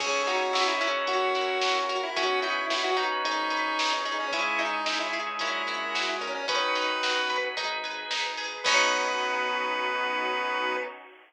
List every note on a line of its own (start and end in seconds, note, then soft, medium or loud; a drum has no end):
0.00 0.49 C#2 medium
0.00 0.43 C#4 medium
0.00 1.07 C#4 medium
0.00 0.80 C#4 medium
0.00 1.97 C#4 medium
0.00 0.43 D#4 loud
0.00 1.07 D#4 medium
0.00 0.43 E4 loud
0.00 1.07 E4 medium
0.00 0.23 G#4 loud
0.00 0.43 G#4 loud
0.00 1.07 G#4 medium
0.00 1.97 C#5 medium
0.00 kick loud
0.00 crash medium
0.27 1.04 D#4 medium
0.27 0.53 F#4 loud
0.27 closed hi-hat medium
0.53 1.03 C#2 medium
0.53 1.05 E4 medium
0.53 0.67 F#4 loud
0.53 snare loud
0.67 0.80 C#4 loud
0.67 0.80 D#4 loud
0.67 0.80 E4 medium
0.67 0.81 E4 loud
0.67 0.80 G#4 loud
0.81 2.10 C#4 medium
0.81 1.30 C#4 loud
0.81 1.30 E4 loud
0.81 1.30 F#4 loud
0.81 1.30 A#4 medium
0.81 closed hi-hat medium
1.07 1.57 F#2 medium
1.07 2.15 C#4 medium
1.07 2.15 E4 medium
1.07 1.78 F#4 loud
1.07 2.15 F#4 medium
1.07 2.15 A#4 medium
1.07 kick medium
1.07 closed hi-hat medium
1.35 1.79 C#4 medium
1.35 2.12 E4 medium
1.35 1.79 E4 medium
1.35 1.79 F#4 loud
1.35 1.79 A#4 medium
1.35 closed hi-hat medium
1.61 2.11 F#2 medium
1.61 2.14 F#4 medium
1.61 snare loud
1.89 2.02 F#4 loud
1.89 2.15 A#4 medium
1.89 closed hi-hat medium
2.03 2.16 E4 loud
2.16 2.65 B1 medium
2.16 4.25 C#4 medium
2.16 2.59 C#4 loud
2.16 3.19 C#4 medium
2.16 3.23 C#4 medium
2.16 2.59 D#4 loud
2.16 3.23 D#4 medium
2.16 2.59 F#4 loud
2.16 2.40 F#4 loud
2.16 3.23 F#4 medium
2.16 2.59 B4 loud
2.16 3.23 B4 medium
2.16 4.25 C#5 medium
2.16 kick loud
2.16 closed hi-hat medium
2.42 2.96 D#4 medium
2.42 2.66 E4 loud
2.42 closed hi-hat medium
2.70 3.19 B1 medium
2.70 2.83 E4 loud
2.70 3.22 F#4 medium
2.70 snare medium
2.84 3.05 C#4 medium
2.84 3.05 D#4 medium
2.84 3.05 F#4 medium
2.84 2.97 F#4 loud
2.84 3.05 B4 medium
2.97 3.79 D#4 medium
2.97 closed hi-hat medium
3.12 3.23 C#4 medium
3.12 3.23 D#4 medium
3.12 3.23 F#4 loud
3.12 3.23 B4 medium
3.24 3.73 G#1 medium
3.24 3.93 D#4 loud
3.24 4.32 D#4 medium
3.24 3.47 D#4 loud
3.24 4.32 G#4 medium
3.24 3.47 G#4 loud
3.24 4.32 B4 medium
3.24 3.47 B4 loud
3.24 kick medium
3.24 closed hi-hat medium
3.50 3.94 D#4 loud
3.50 3.94 G#4 medium
3.50 3.94 B4 medium
3.50 4.29 B4 medium
3.50 closed hi-hat medium
3.79 4.27 G#1 medium
3.79 4.30 D#4 medium
3.79 snare loud
4.05 4.18 D#4 loud
4.05 4.31 G#4 medium
4.05 closed hi-hat medium
4.20 4.33 C#4 loud
4.32 4.81 C#2 medium
4.32 6.28 G#3 medium
4.32 5.39 C#4 medium
4.32 5.35 C#4 medium
4.32 4.76 C#4 loud
4.32 5.39 D#4 medium
4.32 4.76 D#4 loud
4.32 5.39 E4 medium
4.32 4.76 E4 loud
4.32 4.59 E4 loud
4.32 5.39 G#4 medium
4.32 6.28 G#4 medium
4.32 4.76 G#4 loud
4.32 kick medium
4.32 closed hi-hat medium
4.59 5.36 D#4 medium
4.59 4.85 D#4 loud
4.59 closed hi-hat medium
4.86 5.35 C#2 medium
4.86 4.99 D#4 loud
4.86 5.38 E4 medium
4.86 snare medium
5.00 5.22 C#4 loud
5.00 5.22 D#4 medium
5.00 5.12 E4 loud
5.00 5.22 E4 medium
5.00 5.22 G#4 medium
5.13 5.39 G#4 medium
5.13 closed hi-hat medium
5.26 5.37 C#4 medium
5.26 5.37 D#4 medium
5.26 5.37 E4 medium
5.26 5.37 G#4 loud
5.39 5.89 A#1 medium
5.39 6.47 C#4 medium
5.39 5.62 C#4 loud
5.39 6.44 C#4 medium
5.39 6.47 E4 medium
5.39 6.09 E4 loud
5.39 5.62 E4 loud
5.39 6.47 F#4 medium
5.39 5.62 F#4 loud
5.39 6.47 A#4 medium
5.39 5.62 A#4 loud
5.39 kick medium
5.39 closed hi-hat medium
5.67 6.10 C#4 medium
5.67 6.10 E4 loud
5.67 6.45 E4 medium
5.67 6.10 F#4 medium
5.67 6.10 A#4 medium
5.67 closed hi-hat medium
5.95 6.21 A#1 medium
5.95 6.46 F#4 medium
5.95 snare medium
6.21 6.97 B1 medium
6.21 6.34 C#4 loud
6.21 6.47 A#4 medium
6.21 closed hi-hat medium
6.34 6.47 C#4 loud
6.48 7.13 D#3 medium
6.48 7.51 C#4 medium
6.48 6.92 C#4 loud
6.48 7.56 C#4 medium
6.48 7.13 D#4 medium
6.48 6.92 D#4 medium
6.48 7.56 D#4 medium
6.48 6.92 F#4 loud
6.48 7.56 F#4 medium
6.48 7.38 B4 loud
6.48 6.92 B4 loud
6.48 7.56 B4 medium
6.48 kick loud
6.48 closed hi-hat loud
6.75 7.53 D#4 medium
6.75 closed hi-hat medium
7.02 7.51 B1 medium
7.02 7.55 F#4 medium
7.02 snare medium
7.15 7.37 C#4 medium
7.15 7.37 D#4 medium
7.15 7.37 F#4 loud
7.15 7.37 B4 medium
7.30 7.56 B4 medium
7.30 kick medium
7.30 closed hi-hat medium
7.44 7.55 C#4 loud
7.44 7.55 D#4 medium
7.44 7.55 F#4 medium
7.44 7.55 B4 medium
7.56 8.05 G#1 medium
7.56 7.78 D#4 loud
7.56 8.10 D#4 medium
7.56 8.64 D#4 medium
7.56 7.78 G#4 loud
7.56 8.64 G#4 medium
7.56 7.78 B4 loud
7.56 8.64 B4 medium
7.56 kick medium
7.56 closed hi-hat medium
7.83 8.26 D#4 medium
7.83 8.26 G#4 loud
7.83 8.26 B4 medium
7.83 8.61 B4 medium
7.83 closed hi-hat medium
8.10 8.59 G#1 medium
8.10 8.62 D#4 medium
8.10 snare medium
8.38 8.64 G#4 medium
8.38 open hi-hat medium
8.64 10.77 B1 loud
8.64 10.77 B3 loud
8.64 10.77 B3 medium
8.64 10.77 B3 loud
8.64 10.77 C#4 loud
8.64 10.77 D#4 medium
8.64 10.77 D#4 loud
8.64 10.77 F#4 medium
8.64 10.77 F#4 loud
8.64 10.76 B4 loud
8.64 kick loud
8.64 crash loud
8.68 10.77 F#4 loud